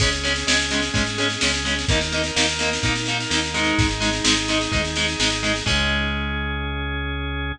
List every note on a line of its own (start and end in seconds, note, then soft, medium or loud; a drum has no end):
0.00 0.44 C#2 medium
0.00 0.09 G#3 medium
0.00 1.86 C#4 medium
0.00 0.09 C#4 loud
0.00 1.86 G#4 medium
0.00 kick loud
0.00 snare loud
0.00 crash loud
0.13 snare medium
0.24 0.33 G#3 medium
0.24 0.33 C#4 medium
0.24 snare medium
0.36 snare medium
0.47 0.90 C#2 medium
0.47 0.57 G#3 medium
0.47 0.57 C#4 medium
0.47 snare loud
0.60 snare medium
0.71 0.81 G#3 medium
0.71 0.81 C#4 medium
0.71 snare loud
0.82 snare medium
0.94 1.37 G#2 medium
0.94 1.03 G#3 medium
0.94 1.03 C#4 medium
0.94 kick loud
0.94 snare loud
1.06 snare medium
1.18 1.27 G#3 medium
1.18 1.27 C#4 medium
1.18 snare medium
1.30 snare medium
1.41 1.85 C#2 medium
1.41 1.51 G#3 medium
1.41 1.51 C#4 medium
1.41 snare loud
1.54 snare medium
1.65 1.74 G#3 medium
1.65 1.74 C#4 medium
1.65 snare medium
1.79 snare medium
1.88 2.31 D#2 medium
1.88 1.99 A#3 loud
1.88 3.75 D#4 medium
1.88 1.99 D#4 loud
1.88 3.75 A#4 medium
1.88 kick loud
1.88 snare loud
2.01 snare medium
2.12 2.22 A#3 medium
2.12 2.22 D#4 medium
2.12 snare medium
2.24 snare medium
2.36 2.79 D#2 medium
2.36 2.46 A#3 medium
2.36 2.46 D#4 medium
2.36 snare loud
2.48 snare medium
2.59 2.70 A#3 medium
2.59 2.70 D#4 medium
2.59 snare loud
2.73 snare loud
2.83 3.26 A#2 medium
2.83 2.93 A#3 medium
2.83 2.93 D#4 medium
2.83 kick loud
2.83 snare loud
2.96 snare medium
3.06 3.17 A#3 medium
3.06 3.17 D#4 medium
3.06 snare medium
3.20 snare medium
3.30 3.73 D#2 medium
3.30 3.40 A#3 medium
3.30 3.40 D#4 medium
3.30 snare loud
3.44 snare medium
3.54 3.87 G#3 medium
3.54 3.87 D#4 loud
3.54 snare medium
3.65 snare medium
3.78 4.21 G#1 loud
3.78 5.63 D#4 medium
3.78 5.63 G#4 medium
3.78 kick loud
3.78 snare loud
3.89 snare medium
4.00 4.10 G#3 medium
4.00 4.10 D#4 medium
4.00 snare loud
4.13 snare medium
4.24 4.68 G#1 medium
4.24 4.34 G#3 medium
4.24 4.34 D#4 medium
4.24 snare loud
4.37 snare medium
4.48 4.58 G#3 medium
4.48 4.58 D#4 medium
4.48 snare loud
4.61 snare medium
4.72 5.16 D#2 medium
4.72 4.81 G#3 medium
4.72 4.81 D#4 medium
4.72 kick loud
4.72 snare medium
4.85 snare medium
4.96 5.06 G#3 medium
4.96 5.06 D#4 medium
4.96 snare loud
5.08 snare medium
5.19 5.62 G#1 medium
5.19 5.29 G#3 medium
5.19 5.29 D#4 medium
5.19 snare loud
5.32 snare medium
5.43 5.52 G#3 loud
5.43 5.52 D#4 medium
5.43 snare medium
5.56 snare medium
5.66 7.53 C#2 loud
5.66 7.51 G#3 medium
5.66 7.52 C#4 loud
5.66 7.51 C#4 loud
5.66 7.52 G#4 medium
5.66 kick loud
5.66 crash loud